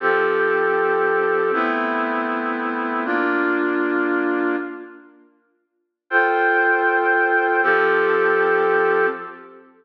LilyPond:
\new Staff { \time 3/4 \key f \major \tempo 4 = 118 <f c' g' a'>2. | <a b c' e'>2. | <bes d' f'>2. | r2. |
<f' a' c'' g''>2. | <f c' g' a'>2. | }